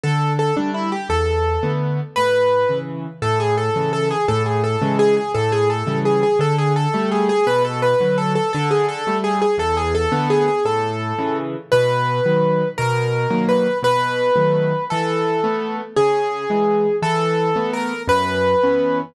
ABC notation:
X:1
M:6/8
L:1/8
Q:3/8=113
K:A
V:1 name="Acoustic Grand Piano"
A2 A D E =G | A4 z2 | B4 z2 | A G A2 A G |
A G A2 G G | A G A2 G G | A G A2 G G | B A B2 A A |
A G A2 G G | A G A2 G G | A5 z | [K:B] B6 |
A4 B2 | B6 | =A6 | G6 |
=A4 ^A2 | B6 |]
V:2 name="Acoustic Grand Piano"
D,3 [=G,A,]3 | E,,3 [D,A,B,]3 | A,,3 [C,E,]3 | A,,3 [C,E,]3 |
A,,3 [C,E,G,]3 | A,,3 [C,E,=G,]3 | D,3 [=G,A,]3 | B,,3 [D,F,]3 |
D,3 [=G,A,]3 | E,,3 [D,A,B,]3 | A,,3 [C,E,]3 | [K:B] B,,3 [D,F,]3 |
B,,3 [D,F,A,]3 | B,,3 [D,F,=A,]3 | E,3 [=A,B,]3 | C,3 [E,G,]3 |
E,3 [=A,B,]3 | F,,3 [E,B,C]3 |]